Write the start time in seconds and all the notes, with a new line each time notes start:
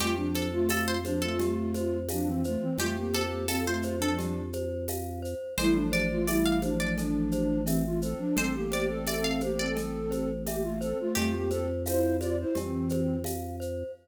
0.00 F2 A3 F4 G4, cowbell, low conga, shaker
0.16 F3 D4
0.35 A4 C5, high conga, shaker
0.53 A3 F4
0.69 A3 F4 A4 F5, tambourine, cowbell, high conga, shaker
0.88 C5
1.05 F3 D4 C5, high conga, shaker
1.22 A3 F4 A4
1.39 G4, cowbell, low conga, shaker
1.74 C5, high conga, shaker
2.09 F3 D4 F5, tambourine, cowbell, high conga, shaker
2.26 E3 C4
2.44 A3 F4 C5, shaker
2.61 E3 C4
2.78 F2 A3 F4 G4, cowbell, low conga, shaker
2.96 A#3 G4
3.14 A4 C5, high conga, shaker
3.48 C4 A4 F5, tambourine, cowbell, high conga, shaker
3.66 A3 F4 C5
3.82 C5, high conga, shaker
3.99 F3 D4 A4
4.18 G4, cowbell, low conga, shaker
4.53 C5, high conga, shaker
4.88 F5, tambourine, cowbell, high conga, shaker
5.22 C5, shaker
5.58 A1 G3 E4 A4 C5, cowbell, low conga, shaker
5.74 F3 D4
5.92 C5 D5, high conga, shaker
6.11 A3 F4
6.27 G3 E4 D5 E5, tambourine, cowbell, high conga, shaker
6.45 F5
6.62 F3 D4 C5, high conga, shaker
6.80 F3 D4 D5
6.97 A4, cowbell, low conga, shaker
7.31 C5, high conga, shaker
7.65 E3 C4 E5, tambourine, cowbell, high conga, shaker
7.85 A3 F4
8.02 C4 A4 C5, shaker
8.18 F3 D4
8.36 A1 C4 A4 C5, cowbell, low conga, shaker
8.54 A#3 G4
8.72 C5 D5, high conga, shaker
8.89 C4 A4
9.07 C4 A4 D5 E5, tambourine, cowbell, high conga, shaker
9.24 F5
9.41 A#3 G4 C5, high conga, shaker
9.58 C4 A4 D5
9.76 A4, cowbell, low conga, shaker
10.11 C5, high conga, shaker
10.45 A#3 G4 E5, tambourine, cowbell, high conga, shaker
10.62 A3 F4
10.81 C4 A4 C5, shaker
11.00 A3 F4
11.15 F2 A3 F4 G4, cowbell, low conga, shaker
11.33 A#3 G4
11.50 C4 A4 C5, high conga, shaker
11.85 E4 C5 F5, tambourine, cowbell, high conga, shaker
12.20 F4 C5 D5, high conga, shaker
12.40 E4 C5
12.55 F2 E3 C4 G4, cowbell, low conga, shaker
12.89 C5, high conga, shaker
13.24 F5, tambourine, cowbell, high conga, shaker
13.60 C5, shaker